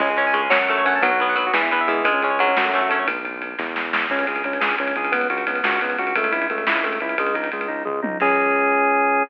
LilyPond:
<<
  \new Staff \with { instrumentName = "Overdriven Guitar" } { \time 6/8 \key cis \minor \tempo 4. = 117 gis8 cis'8 gis8 fis8 a8 cis'8 | fis8 b8 fis8 e8 b8 e8 | gis8 cis'8 fis4 a8 cis'8 | r2. |
r2. | r2. | r2. | r2. |
r2. | }
  \new Staff \with { instrumentName = "Drawbar Organ" } { \time 6/8 \key cis \minor cis'16 gis'16 cis''16 gis''16 cis''16 gis'16 cis'16 fis'16 a'16 cis''16 fis''16 a''16 | b16 fis'16 b'16 fis''16 b'16 fis'16 b16 e'16 b'16 e''16 gis8~ | gis16 cis'16 gis'16 cis''16 gis'16 cis'16 fis16 a16 cis'16 fis'16 a'16 cis''16 | r2. |
cis'8 gis'8 cis'8 gis'8 cis'8 gis'8 | b8 fis'8 b8 fis'8 b8 fis'8 | a8 e'8 a8 e'8 a8 e'8 | gis8 dis'8 gis8 dis'8 gis8 dis'8 |
<cis' gis'>2. | }
  \new Staff \with { instrumentName = "Synth Bass 1" } { \clef bass \time 6/8 \key cis \minor cis,4. fis,4. | b,,4. e,4. | cis,4. fis,4. | b,,4. e,4. |
cis,8 cis,8 cis,8 cis,8 cis,8 cis,8~ | cis,8 cis,8 cis,8 cis,8 cis,8 cis,8 | cis,8 cis,8 cis,8 cis,8 cis,8 cis,8 | cis,8 cis,8 cis,8 cis,8 cis,8 cis,8 |
cis,2. | }
  \new DrumStaff \with { instrumentName = "Drums" } \drummode { \time 6/8 <cymc bd>8 cymr8 cymr8 sn8 cymr8 cymr8 | <bd cymr>8 cymr8 cymr8 sn8 cymr8 cymr8 | <bd cymr>8 cymr8 cymr8 sn8 cymr8 cymr8 | <bd cymr>8 cymr8 cymr8 <bd sn>8 sn8 sn8 |
<cymc bd>16 cymr16 cymr16 cymr16 cymr16 cymr16 sn16 cymr16 cymr16 cymr16 cymr16 cymr16 | <bd cymr>16 cymr16 cymr16 cymr16 cymr16 cymr16 sn16 cymr16 cymr16 cymr16 cymr16 cymr16 | <bd cymr>16 cymr16 cymr16 cymr16 cymr16 cymr16 sn16 cymr16 cymr16 cymr16 cymr16 cymr16 | <bd cymr>16 cymr16 cymr16 cymr16 cymr16 cymr16 <bd tomfh>8 toml8 tommh8 |
<cymc bd>4. r4. | }
>>